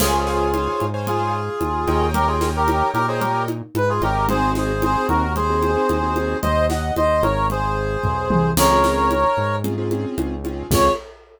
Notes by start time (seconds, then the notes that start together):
0.00 C#2 F4 G#4 C5 C#5 F5 G#5, crash, low conga
0.13 C5 C#5 F5 G#5
0.27 C5 C#5 F5 G#5, snare
0.54 C5 C#5 F5 G#5, high conga
0.80 G#2, high conga
0.94 C5 C#5 F5 G#5
1.07 F4 G#4, low conga
1.61 D#2, high conga
1.87 D#2 A#4 C#5 D#5 G5, high conga
2.14 G4 A#4, low conga
2.27 F4 G#4 A#4 C#5 D#5 G5
2.41 A#4 C#5 D#5 G5, snare, high conga
2.56 G4 A#4
2.68 A#4 C#5 D#5 G5, high conga
2.94 A#2 G4 A#4, high conga
3.08 G#4 A#4 C5 C#5 D#5 G5
3.20 G4 A#4, low conga
3.48 high conga
3.75 G#2 B4, high conga
3.89 F4 G#4
4.02 G#1 G4 A#4 C#5 D#5 G5, high conga
4.29 C4 D#4 F#4 G#4 C5, low conga
4.55 G#4 C5, snare, high conga
4.82 C4 D#4 F#4 G#4 C5, high conga
5.08 D#2 F#4 A#4, high conga
5.36 G#4 C5, low conga
5.49 C4 D#4 F#4 G#4
5.62 high conga
5.76 C4 D#4 F#4 G#4
5.89 D#2, high conga
6.03 C4 D#4 F#4 G#4
6.16 C4 D#4 F#4 G#4, high conga
6.42 D#2 C5 D#5, low conga
6.70 D#5 F#5, snare, high conga
6.96 D#2 C5 D#5, high conga
7.22 G#1 A#4 C#5, high conga
7.50 G#4 C5, low conga
8.04 B1, kick, floor tom
8.30 C2, high tom
8.57 C#2 C4 C#4 F4 G#4 A#4 C#5, crash, low conga
8.70 C4 C#4 F4 G#4
8.84 snare, high conga
9.11 high conga
9.37 G#2
9.64 C4 C#4 F4 G#4, low conga
9.78 C4 C#4 F4 G#4
9.91 C4 C#4 F4 G#4, high conga
10.18 C#2, high conga
10.45 C4 C#4 F4 G#4, high conga
10.71 C#2 C4 C#4 F4 G#4 C#5, kick, crash